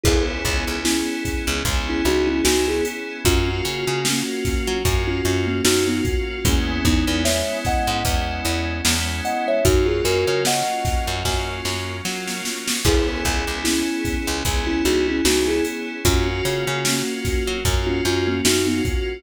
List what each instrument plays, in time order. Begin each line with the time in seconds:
0.04 electric bass (finger) C#2, electric piano 2 B3 C#4 E4 G#4, kalimba E4 G#4, kick, crash
0.45 electric bass (finger) C#2, kick, closed hi-hat
0.68 electric bass (finger) C#2
0.84 electric piano 2 B3 C#4 E4 G#4, kalimba C#4 E4, snare
1.25 kick, snare, closed hi-hat
1.47 electric bass (finger) C#2
1.65 electric bass (finger) C#2, electric piano 2 B3 C#4 E4 G#4, kick, closed hi-hat
1.89 kalimba C#4 E4
2.05 electric bass (finger) C#2, kalimba D#4 F#4, closed hi-hat
2.27 kalimba C#4 E4
2.44 electric bass (finger) C#2, electric piano 2 B3 C#4 E4 G#4, kalimba D#4 F#4, snare
2.68 kalimba E4 G#4
2.85 closed hi-hat
3.25 electric bass (finger) F#2, electric piano 2 A#3 C#4 F4 F#4, kalimba C#4 F4, kick, closed hi-hat
3.65 electric bass (finger) C#3, closed hi-hat
3.87 electric bass (finger) C#3
4.05 electric piano 2 A#3 C#4 F4 F#4, kalimba A#3 C#4, snare
4.45 kick, snare, closed hi-hat
4.67 electric bass (finger) F#3
4.84 electric bass (finger) F#2, electric piano 2 A#3 C#4 F4 F#4, kick, closed hi-hat
5.07 kalimba C#4 F4
5.25 electric bass (finger) F#2, kalimba C#4 F4, snare, closed hi-hat
5.47 kalimba A#3 C#4
5.64 electric bass (finger) F#2, electric piano 2 A#3 C#4 F4 F#4, kalimba D#4 F#4, snare
5.88 kalimba B3 D#4
6.05 kick, closed hi-hat
6.44 electric bass (finger) E2, electric piano 2 G#3 B3 C#4 E4, kalimba A#3 C#4, kick, closed hi-hat
6.85 electric bass (finger) E2, kalimba B3 D#4, kick, snare, closed hi-hat
7.07 electric bass (finger) E2
7.25 electric piano 2 G#3 B3 C#4 E4, kalimba C#5 E5, snare
7.65 kalimba D#5 F#5, kick, snare, closed hi-hat
7.87 electric bass (finger) G#2
8.05 electric bass (finger) E2, electric piano 2 G#3 B3 C#4 E4, kick, closed hi-hat
8.45 electric bass (finger) E2, closed hi-hat
8.85 electric bass (finger) E2, electric piano 2 G#3 B3 C#4 E4, snare
9.25 kalimba D#5 F#5, closed hi-hat
9.48 kalimba C#5 E5
9.65 electric bass (finger) F#2, electric piano 2 F#3 A#3 C#4 F4, kalimba D#4 F#4, kick, closed hi-hat
9.86 kalimba F4 G#4
10.04 electric bass (finger) F#2, kalimba F#4 A#4, closed hi-hat
10.27 electric bass (finger) C#3
10.45 electric piano 2 F#3 A#3 C#4 F4, kalimba D#5 F#5, snare
10.85 kick, snare, closed hi-hat
11.07 electric bass (finger) F#2
11.23 electric bass (finger) F#2, electric piano 2 F#3 A#3 C#4 F4, kick, snare
11.65 electric bass (finger) F#2, snare
12.05 electric piano 2 F#3 A#3 C#4 F4, electric bass (finger) F#3, snare
12.28 snare
12.45 snare
12.68 snare
12.85 electric bass (finger) C#2, electric piano 2 B3 C#4 E4 G#4, kalimba E4 G#4, kick, crash
13.25 electric bass (finger) C#2, kick, closed hi-hat
13.47 electric bass (finger) C#2
13.64 electric piano 2 B3 C#4 E4 G#4, kalimba C#4 E4, snare
14.05 kick, snare, closed hi-hat
14.27 electric bass (finger) C#2
14.45 electric bass (finger) C#2, electric piano 2 B3 C#4 E4 G#4, kick, closed hi-hat
14.67 kalimba C#4 E4
14.85 electric bass (finger) C#2, kalimba D#4 F#4, closed hi-hat
15.08 kalimba C#4 E4
15.25 electric bass (finger) C#2, electric piano 2 B3 C#4 E4 G#4, kalimba D#4 F#4, snare
15.48 kalimba E4 G#4
15.65 closed hi-hat
16.05 electric bass (finger) F#2, electric piano 2 A#3 C#4 F4 F#4, kalimba C#4 F4, kick, closed hi-hat
16.45 electric bass (finger) C#3, closed hi-hat
16.67 electric bass (finger) C#3
16.85 electric piano 2 A#3 C#4 F4 F#4, kalimba A#3 C#4, snare
17.25 kick, snare, closed hi-hat
17.47 electric bass (finger) F#3
17.65 electric bass (finger) F#2, electric piano 2 A#3 C#4 F4 F#4, kick, closed hi-hat
17.87 kalimba C#4 F4
18.05 electric bass (finger) F#2, kalimba C#4 F4, snare, closed hi-hat
18.27 kalimba A#3 C#4
18.45 electric bass (finger) F#2, electric piano 2 A#3 C#4 F4 F#4, kalimba D#4 F#4, snare
18.67 kalimba B3 D#4
18.85 kick, closed hi-hat